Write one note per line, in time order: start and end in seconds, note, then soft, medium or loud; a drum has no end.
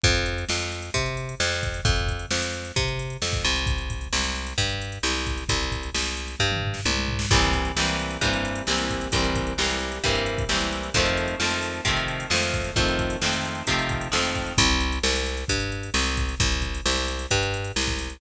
0.04 0.45 F2 loud
0.04 kick loud
0.04 closed hi-hat loud
0.15 closed hi-hat medium
0.26 closed hi-hat medium
0.38 closed hi-hat medium
0.49 0.90 F2 medium
0.49 snare loud
0.60 closed hi-hat medium
0.72 closed hi-hat medium
0.82 closed hi-hat medium
0.94 1.35 C3 medium
0.94 kick medium
0.94 closed hi-hat medium
1.06 closed hi-hat medium
1.17 closed hi-hat medium
1.29 closed hi-hat medium
1.40 1.81 F2 medium
1.40 snare loud
1.52 closed hi-hat medium
1.63 kick medium
1.63 closed hi-hat medium
1.74 closed hi-hat medium
1.85 2.26 F2 medium
1.85 kick loud
1.85 closed hi-hat loud
1.96 closed hi-hat medium
2.08 kick medium
2.08 closed hi-hat medium
2.19 closed hi-hat medium
2.30 2.72 F2 medium
2.30 snare loud
2.42 closed hi-hat medium
2.54 closed hi-hat medium
2.65 closed hi-hat medium
2.76 3.17 C3 medium
2.76 kick loud
2.76 closed hi-hat loud
2.88 closed hi-hat medium
2.99 closed hi-hat medium
3.10 closed hi-hat medium
3.22 3.44 F2 medium
3.22 snare loud
3.33 kick loud
3.33 closed hi-hat medium
3.44 4.08 C2 medium
3.44 closed hi-hat medium
3.56 closed hi-hat medium
3.66 kick loud
3.66 closed hi-hat medium
3.78 closed hi-hat medium
3.90 kick medium
3.90 closed hi-hat medium
4.01 closed hi-hat medium
4.13 4.54 C2 medium
4.13 snare loud
4.24 closed hi-hat medium
4.36 closed hi-hat medium
4.47 closed hi-hat medium
4.58 4.99 G2 medium
4.58 kick medium
4.58 closed hi-hat medium
4.69 closed hi-hat medium
4.81 closed hi-hat medium
4.92 closed hi-hat medium
5.03 5.44 C2 medium
5.03 snare loud
5.15 closed hi-hat medium
5.26 kick medium
5.26 closed hi-hat medium
5.38 closed hi-hat medium
5.49 5.90 C2 medium
5.49 kick loud
5.49 closed hi-hat loud
5.60 closed hi-hat medium
5.72 kick medium
5.72 closed hi-hat medium
5.83 closed hi-hat medium
5.94 6.35 C2 medium
5.94 snare loud
6.05 closed hi-hat medium
6.17 closed hi-hat medium
6.28 closed hi-hat medium
6.39 6.81 G2 medium
6.39 kick medium
6.51 mid tom medium
6.62 floor tom medium
6.74 snare medium
6.85 7.26 C2 medium
6.85 high tom medium
7.08 floor tom medium
7.19 snare loud
7.31 7.72 C2 medium
7.31 7.72 E3 loud
7.31 7.72 G3 medium
7.31 7.72 A#3 medium
7.31 7.72 C4 medium
7.31 kick loud
7.31 crash loud
7.42 closed hi-hat medium
7.53 kick medium
7.53 closed hi-hat medium
7.65 closed hi-hat medium
7.76 8.17 C2 medium
7.76 8.17 E3 medium
7.76 8.17 G3 medium
7.76 8.17 A#3 medium
7.76 8.17 C4 medium
7.76 snare loud
7.87 closed hi-hat medium
7.99 closed hi-hat medium
8.11 closed hi-hat medium
8.21 8.62 G2 medium
8.21 8.62 E3 medium
8.21 8.62 G3 medium
8.21 8.62 A#3 medium
8.21 8.62 C4 medium
8.21 kick medium
8.21 closed hi-hat loud
8.33 closed hi-hat medium
8.45 closed hi-hat medium
8.55 closed hi-hat medium
8.67 9.09 C2 medium
8.67 9.08 E3 medium
8.67 9.08 G3 medium
8.67 9.08 A#3 medium
8.67 9.08 C4 medium
8.67 snare loud
8.78 closed hi-hat medium
8.90 kick medium
8.90 closed hi-hat medium
9.01 closed hi-hat medium
9.12 9.54 C2 medium
9.12 9.53 E3 medium
9.12 9.53 G3 medium
9.12 9.53 A#3 medium
9.12 9.53 C4 medium
9.12 kick loud
9.12 closed hi-hat loud
9.24 closed hi-hat medium
9.36 kick medium
9.36 closed hi-hat medium
9.47 closed hi-hat medium
9.58 9.99 C2 medium
9.58 9.99 E3 medium
9.58 9.99 G3 medium
9.58 9.99 A#3 medium
9.58 9.99 C4 medium
9.58 snare loud
9.69 closed hi-hat medium
9.80 closed hi-hat medium
9.92 closed hi-hat medium
10.04 10.44 G2 medium
10.04 10.44 E3 medium
10.04 10.44 G3 medium
10.04 10.44 A#3 medium
10.04 10.44 C4 medium
10.04 kick medium
10.04 closed hi-hat medium
10.15 closed hi-hat medium
10.26 closed hi-hat medium
10.38 kick medium
10.38 closed hi-hat medium
10.49 10.90 C2 medium
10.49 10.90 E3 medium
10.49 10.90 G3 medium
10.49 10.90 A#3 medium
10.49 10.90 C4 medium
10.49 snare loud
10.61 closed hi-hat medium
10.72 closed hi-hat medium
10.83 closed hi-hat medium
10.94 11.35 F2 medium
10.94 11.36 D#3 loud
10.94 11.36 F3 loud
10.94 11.36 A3 medium
10.94 11.36 C4 loud
10.94 kick loud
10.94 closed hi-hat medium
11.06 closed hi-hat medium
11.17 closed hi-hat medium
11.28 closed hi-hat medium
11.40 11.81 F2 medium
11.40 11.81 D#3 medium
11.40 11.81 F3 medium
11.40 11.81 A3 medium
11.40 11.81 C4 medium
11.40 snare loud
11.51 closed hi-hat medium
11.63 closed hi-hat medium
11.73 closed hi-hat medium
11.85 12.26 C3 medium
11.85 12.26 D#3 medium
11.85 12.26 F3 medium
11.85 12.26 A3 medium
11.85 kick medium
11.85 closed hi-hat loud
11.89 12.26 C4 medium
11.96 closed hi-hat medium
12.08 closed hi-hat medium
12.20 closed hi-hat medium
12.30 12.71 F2 medium
12.30 12.71 D#3 medium
12.30 12.71 F3 medium
12.30 12.71 A3 medium
12.30 12.71 C4 medium
12.30 snare loud
12.42 closed hi-hat medium
12.53 kick medium
12.53 closed hi-hat medium
12.64 closed hi-hat medium
12.76 13.17 F2 medium
12.76 13.17 D#3 medium
12.76 13.17 F3 medium
12.76 13.17 A3 medium
12.76 13.17 C4 medium
12.76 kick loud
12.76 closed hi-hat loud
12.88 closed hi-hat medium
12.99 kick medium
12.99 closed hi-hat medium
13.10 closed hi-hat medium
13.21 13.63 F2 medium
13.21 13.63 D#3 medium
13.21 13.63 F3 medium
13.21 13.63 A3 medium
13.21 13.63 C4 medium
13.21 snare loud
13.33 closed hi-hat medium
13.45 closed hi-hat medium
13.55 closed hi-hat medium
13.67 14.08 C3 medium
13.67 14.08 D#3 medium
13.67 14.08 F3 medium
13.67 14.08 A3 medium
13.67 14.08 C4 medium
13.67 kick medium
13.67 closed hi-hat loud
13.79 closed hi-hat medium
13.89 kick medium
13.89 closed hi-hat medium
14.01 closed hi-hat medium
14.12 14.54 F2 medium
14.12 14.53 D#3 medium
14.12 14.53 F3 medium
14.12 14.53 A3 medium
14.12 14.53 C4 medium
14.12 snare loud
14.25 closed hi-hat medium
14.35 kick medium
14.35 closed hi-hat medium
14.46 closed hi-hat medium
14.58 14.99 C2 loud
14.58 kick loud
14.58 closed hi-hat loud
14.70 closed hi-hat medium
14.80 closed hi-hat medium
14.92 closed hi-hat medium
15.03 15.44 C2 medium
15.03 snare loud
15.16 closed hi-hat medium
15.26 closed hi-hat medium
15.37 closed hi-hat medium
15.48 15.90 G2 medium
15.48 kick medium
15.48 closed hi-hat loud
15.60 closed hi-hat medium
15.72 closed hi-hat medium
15.83 closed hi-hat medium
15.94 16.35 C2 medium
15.94 snare loud
16.06 closed hi-hat medium
16.17 kick medium
16.17 closed hi-hat medium
16.29 closed hi-hat medium
16.40 16.81 C2 medium
16.40 kick loud
16.40 closed hi-hat loud
16.52 closed hi-hat medium
16.62 kick medium
16.62 closed hi-hat medium
16.74 closed hi-hat medium
16.86 17.26 C2 medium
16.86 snare loud
16.97 closed hi-hat medium
17.08 closed hi-hat medium
17.19 closed hi-hat medium
17.31 17.72 G2 medium
17.31 kick medium
17.31 closed hi-hat loud
17.43 closed hi-hat medium
17.54 closed hi-hat medium
17.64 closed hi-hat medium
17.76 18.17 C2 medium
17.76 snare loud
17.87 kick medium
17.87 closed hi-hat medium
17.99 closed hi-hat medium
18.10 closed hi-hat medium